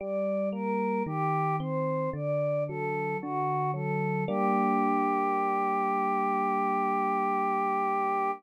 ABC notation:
X:1
M:4/4
L:1/8
Q:1/4=56
K:Gm
V:1 name="Choir Aahs"
d B G c d A ^F A | G8 |]
V:2 name="Electric Piano 1"
G, B, E, C D, ^F, D, F, | [G,B,D]8 |]